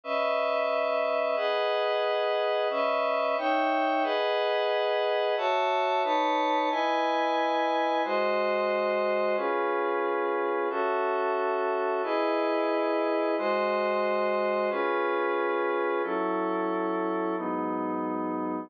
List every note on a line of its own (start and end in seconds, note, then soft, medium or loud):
0.04 1.36 C#4 medium
0.04 1.35 B4 medium
0.04 1.35 D#5 medium
0.04 1.36 E5 medium
1.36 2.68 G#4 medium
1.36 2.68 B4 medium
1.36 2.68 D#5 medium
1.36 2.68 F#5 medium
2.70 3.36 C#4 medium
2.70 3.36 B4 medium
2.70 3.36 D#5 medium
2.70 3.36 E5 medium
3.38 4.04 D#4 medium
3.38 4.04 C#5 medium
3.38 4.04 E5 medium
3.38 4.04 G5 medium
4.03 5.35 G#4 medium
4.03 5.35 B4 loud
4.03 5.35 D#5 medium
4.03 5.35 F#5 medium
5.37 6.03 F#4 medium
5.37 6.03 C#5 medium
5.37 6.03 E5 medium
5.37 6.03 A5 medium
6.03 6.69 D#4 medium
6.03 6.69 B4 medium
6.03 6.69 C#5 medium
6.03 6.69 A5 medium
6.70 8.02 E4 medium
6.70 8.02 B4 loud
6.70 8.02 D#5 medium
6.70 8.02 G#5 loud
8.04 9.36 G#3 medium
8.04 9.36 F#4 medium
8.04 9.36 C5 medium
8.04 9.36 D#5 medium
9.36 10.68 C#4 medium
9.36 10.68 F4 medium
9.36 10.68 G#4 medium
9.36 10.68 B4 medium
10.70 12.02 C#4 medium
10.70 12.02 F#4 medium
10.70 12.02 A4 medium
10.70 12.02 E5 medium
12.03 13.35 E4 loud
12.03 13.35 G#4 medium
12.03 13.35 B4 medium
12.03 13.35 D#5 medium
13.38 14.70 G#3 medium
13.38 14.70 F#4 medium
13.38 14.70 C5 medium
13.38 14.70 D#5 medium
14.70 16.02 C#4 medium
14.70 16.02 F4 medium
14.70 16.02 G#4 medium
14.70 16.02 B4 medium
16.03 17.35 F#3 medium
16.03 17.35 C#4 medium
16.03 17.35 E4 medium
16.03 17.35 A4 medium
17.37 18.69 G#2 medium
17.37 18.69 F#3 medium
17.37 18.69 B3 medium
17.37 18.69 D#4 medium